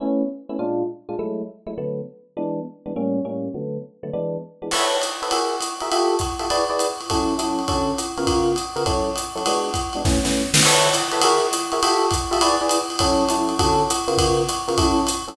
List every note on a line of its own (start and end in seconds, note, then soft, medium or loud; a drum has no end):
0.00 0.22 A3 medium
0.00 0.22 B3 medium
0.00 0.22 C#4 medium
0.00 0.22 E4 medium
0.49 0.56 A3 medium
0.49 0.56 B3 medium
0.49 0.56 C#4 medium
0.49 0.56 E4 medium
0.59 0.83 A#2 medium
0.59 0.83 G#3 medium
0.59 0.83 D4 medium
0.59 0.83 F4 medium
1.09 1.16 A#2 medium
1.09 1.16 G#3 medium
1.09 1.16 D4 medium
1.09 1.16 F4 medium
1.19 1.42 F#3 medium
1.19 1.42 G#3 medium
1.19 1.42 A3 medium
1.19 1.42 E4 medium
1.67 1.74 F#3 medium
1.67 1.74 G#3 medium
1.67 1.74 A3 medium
1.67 1.74 E4 medium
1.78 2.01 D3 medium
1.78 2.01 F#3 medium
1.78 2.01 A3 medium
1.78 2.01 B3 medium
2.37 2.60 E3 medium
2.37 2.60 G#3 medium
2.37 2.60 B3 medium
2.37 2.60 D4 medium
2.86 2.93 E3 medium
2.86 2.93 G#3 medium
2.86 2.93 B3 medium
2.86 2.93 D4 medium
2.96 3.20 A2 medium
2.96 3.20 G3 medium
2.96 3.20 A#3 medium
2.96 3.20 C#4 medium
3.25 3.48 A2 medium
3.25 3.48 G3 medium
3.25 3.48 A#3 medium
3.25 3.48 C#4 medium
3.54 3.78 D3 medium
3.54 3.78 F#3 medium
3.54 3.78 A3 medium
3.54 3.78 B3 medium
4.03 4.10 D3 medium
4.03 4.10 F#3 medium
4.03 4.10 A3 medium
4.03 4.10 B3 medium
4.13 4.37 E3 medium
4.13 4.37 G#3 medium
4.13 4.37 B3 medium
4.13 4.37 D4 medium
4.62 4.69 E3 medium
4.62 4.69 G#3 medium
4.62 4.69 B3 medium
4.62 4.69 D4 medium
4.71 4.96 A4 medium
4.71 4.96 B4 medium
4.71 4.96 C#5 medium
4.71 4.96 E5 medium
4.71 crash loud
4.71 ride medium
5.02 hi-hat pedal medium
5.02 ride medium
5.22 5.29 A4 medium
5.22 5.29 B4 medium
5.22 5.29 C#5 medium
5.22 5.29 E5 medium
5.22 ride medium
5.31 5.55 F#4 medium
5.31 5.55 G#4 medium
5.31 5.55 A#4 medium
5.31 5.55 E5 medium
5.31 ride loud
5.61 hi-hat pedal medium
5.61 ride medium
5.80 5.89 F#4 medium
5.80 5.89 G#4 medium
5.80 5.89 A#4 medium
5.80 5.89 E5 medium
5.80 ride medium
5.92 6.15 F4 medium
5.92 6.15 G4 medium
5.92 6.15 A4 medium
5.92 6.15 E5 medium
5.92 ride loud
6.19 kick medium
6.19 hi-hat pedal medium
6.19 ride medium
6.39 6.47 F4 medium
6.39 6.47 G4 medium
6.39 6.47 A4 medium
6.39 6.47 E5 medium
6.39 ride medium
6.50 6.64 E4 medium
6.50 6.64 G#4 medium
6.50 6.64 B4 medium
6.50 6.64 D5 medium
6.50 ride loud
6.70 6.88 E4 medium
6.70 6.88 G#4 medium
6.70 6.88 B4 medium
6.70 6.88 D5 medium
6.79 hi-hat pedal medium
6.79 ride medium
7.01 ride medium
7.10 7.34 F#3 medium
7.10 7.34 C#4 medium
7.10 7.34 E4 medium
7.10 7.34 A4 medium
7.10 kick medium
7.10 ride loud
7.38 7.62 F#3 medium
7.38 7.62 C#4 medium
7.38 7.62 E4 medium
7.38 7.62 A4 medium
7.38 hi-hat pedal medium
7.38 ride medium
7.59 ride medium
7.68 7.92 D3 medium
7.68 7.92 C#4 medium
7.68 7.92 F#4 medium
7.68 7.92 A4 medium
7.68 kick medium
7.68 ride medium
7.98 hi-hat pedal medium
7.98 ride medium
8.17 8.51 C#3 medium
8.17 8.51 B3 medium
8.17 8.51 F4 medium
8.17 8.51 A#4 medium
8.17 ride medium
8.27 kick medium
8.27 ride loud
8.56 hi-hat pedal medium
8.56 ride medium
8.76 8.83 C#3 medium
8.76 8.83 B3 medium
8.76 8.83 F4 medium
8.76 8.83 A#4 medium
8.76 ride medium
8.86 9.10 F#3 medium
8.86 9.10 C#4 medium
8.86 9.10 E4 medium
8.86 9.10 A4 medium
8.86 kick medium
8.86 ride loud
9.16 hi-hat pedal medium
9.16 ride medium
9.35 9.42 F#3 medium
9.35 9.42 C#4 medium
9.35 9.42 E4 medium
9.35 9.42 A4 medium
9.35 ride medium
9.46 9.70 G#3 medium
9.46 9.70 B3 medium
9.46 9.70 D4 medium
9.46 9.70 F#4 medium
9.46 ride loud
9.74 kick medium
9.74 hi-hat pedal medium
9.74 ride medium
9.93 10.02 G#3 medium
9.93 10.02 B3 medium
9.93 10.02 D4 medium
9.93 10.02 F#4 medium
9.93 ride medium
10.05 10.18 A3 medium
10.05 10.18 B3 medium
10.05 10.18 C#4 medium
10.05 10.18 E4 medium
10.05 kick medium
10.05 snare medium
10.24 10.42 A3 medium
10.24 10.42 B3 medium
10.24 10.42 C#4 medium
10.24 10.42 E4 medium
10.24 snare medium
10.54 10.61 A3 medium
10.54 10.61 B3 medium
10.54 10.61 C#4 medium
10.54 10.61 E4 medium
10.54 snare loud
10.63 10.89 A4 medium
10.63 10.89 B4 loud
10.63 10.89 C#5 loud
10.63 10.89 E5 loud
10.63 crash loud
10.63 ride loud
10.94 hi-hat pedal loud
10.94 ride medium
11.12 11.20 A4 medium
11.12 11.20 B4 medium
11.12 11.20 C#5 medium
11.12 11.20 E5 medium
11.12 ride medium
11.21 11.46 F#4 loud
11.21 11.46 G#4 medium
11.21 11.46 A#4 medium
11.21 11.46 E5 medium
11.21 ride loud
11.53 hi-hat pedal loud
11.53 ride medium
11.72 11.80 F#4 medium
11.72 11.80 G#4 medium
11.72 11.80 A#4 medium
11.72 11.80 E5 medium
11.72 ride medium
11.83 12.06 F4 medium
11.83 12.06 G4 loud
11.83 12.06 A4 medium
11.83 12.06 E5 loud
11.83 ride loud
12.11 kick medium
12.11 hi-hat pedal medium
12.11 ride loud
12.31 12.38 F4 medium
12.31 12.38 G4 medium
12.31 12.38 A4 medium
12.31 12.38 E5 medium
12.31 ride medium
12.41 12.55 E4 medium
12.41 12.55 G#4 medium
12.41 12.55 B4 medium
12.41 12.55 D5 loud
12.41 ride loud
12.61 12.79 E4 medium
12.61 12.79 G#4 medium
12.61 12.79 B4 medium
12.61 12.79 D5 medium
12.69 hi-hat pedal loud
12.69 ride loud
12.90 ride medium
12.99 13.23 F#3 medium
12.99 13.23 C#4 loud
12.99 13.23 E4 medium
12.99 13.23 A4 medium
12.99 kick medium
12.99 ride loud
13.29 13.54 F#3 medium
13.29 13.54 C#4 medium
13.29 13.54 E4 medium
13.29 13.54 A4 medium
13.29 hi-hat pedal medium
13.29 ride medium
13.49 ride medium
13.59 13.83 D3 loud
13.59 13.83 C#4 medium
13.59 13.83 F#4 loud
13.59 13.83 A4 loud
13.59 kick medium
13.59 ride loud
13.90 hi-hat pedal loud
13.90 ride medium
14.08 14.41 C#3 loud
14.08 14.41 B3 medium
14.08 14.41 F4 loud
14.08 14.41 A#4 medium
14.08 ride medium
14.18 kick medium
14.18 ride loud
14.49 hi-hat pedal medium
14.49 ride medium
14.68 14.75 C#3 medium
14.68 14.75 B3 medium
14.68 14.75 F4 medium
14.68 14.75 A#4 medium
14.68 ride medium
14.77 15.01 F#3 medium
14.77 15.01 C#4 medium
14.77 15.01 E4 medium
14.77 15.01 A4 medium
14.77 kick medium
14.77 ride loud
15.07 hi-hat pedal loud
15.07 ride medium
15.28 15.35 F#3 medium
15.28 15.35 C#4 medium
15.28 15.35 E4 medium
15.28 15.35 A4 medium
15.28 ride medium